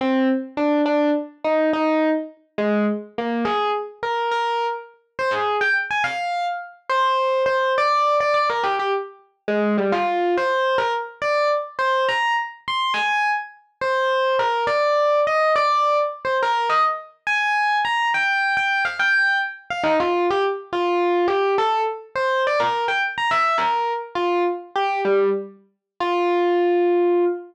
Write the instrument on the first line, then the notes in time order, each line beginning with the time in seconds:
electric piano 1
0.01 C4
0.57 D4
0.86 D4
1.44 D#4
1.73 D#4
2.58 G#3
3.18 A#3
3.45 G#4
4.03 A#4
4.31 A#4
5.19 C5
5.31 G#4
5.61 G5
5.91 G#5
6.04 F5
6.90 C5
7.46 C5
7.78 D5
8.20 D5
8.34 D5
8.50 A#4
8.63 G4
8.79 G4
9.48 G#3
9.78 G3
9.92 F4
10.37 C5
10.78 A#4
11.22 D5
11.79 C5
12.09 A#5
12.68 C6
12.94 G#5
13.81 C5
14.39 A#4
14.67 D5
15.27 D#5
15.56 D5
16.25 C5
16.43 A#4
16.69 D#5
17.27 G#5
17.85 A#5
18.14 G5
18.57 G5
18.85 F5
18.99 G5
19.70 F5
19.83 D#4
20.00 F4
20.30 G4
20.73 F4
21.28 G4
21.58 A4
22.16 C5
22.47 D5
22.60 A#4
22.88 G5
23.18 A#5
23.31 E5
23.58 A#4
24.15 F4
24.76 G4
25.05 G3
26.00 F4